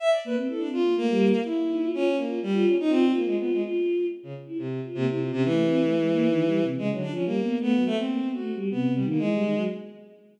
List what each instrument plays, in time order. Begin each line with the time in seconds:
0.00 violin E5
0.10 violin D5
0.25 choir aahs A#3, violin B4
0.36 choir aahs C4
0.48 choir aahs E4, violin A4
0.58 violin D4
0.64 choir aahs C4
0.73 violin F4
0.80 choir aahs A#3
0.97 choir aahs A3, violin A#3
1.10 choir aahs G3
1.45 violin E4
1.69 choir aahs D#4
1.83 choir aahs F4
1.93 violin C#4, choir aahs F4
2.09 choir aahs C#4
2.17 violin A#3
2.26 choir aahs F4
2.43 violin G3
2.53 choir aahs F4
2.66 violin C#4
2.80 violin D#4
2.90 violin C4, choir aahs F4
3.06 choir aahs F4
3.15 violin A#3
3.21 choir aahs F4
3.26 violin G#3
3.38 violin B3, choir aahs F4
3.52 violin G#3
3.62 choir aahs F4
4.23 violin C#3
4.47 choir aahs E4
4.58 violin C3
4.85 choir aahs F4
4.95 violin C3, choir aahs A#3
5.08 violin C3, choir aahs E4
5.20 choir aahs F4
5.32 violin C3, choir aahs C#4
5.44 violin E3
5.49 choir aahs A3
5.66 choir aahs C4
5.81 choir aahs A3
5.98 choir aahs G#3
6.13 choir aahs A#3
6.28 choir aahs D#3
6.45 choir aahs G3
6.62 choir aahs C3
6.77 choir aahs C#3, violin G#3
6.91 choir aahs D3, violin F#3
7.01 violin D4
7.10 choir aahs F3, violin C#4
7.25 choir aahs G3, violin A#3
7.41 choir aahs B3
7.59 choir aahs A3, violin B3
7.74 choir aahs F#3
7.86 violin A3
7.91 choir aahs A3
7.97 violin C4
8.05 choir aahs A#3
8.23 choir aahs B3
8.34 choir aahs A3, violin F#4
8.55 choir aahs G3
8.71 choir aahs C3, violin B3
8.88 choir aahs C3
8.95 violin G3
9.04 choir aahs D#3
9.09 violin A#3
9.18 choir aahs E3, violin G#3
9.32 choir aahs G3
9.43 choir aahs D#3
9.55 choir aahs F#3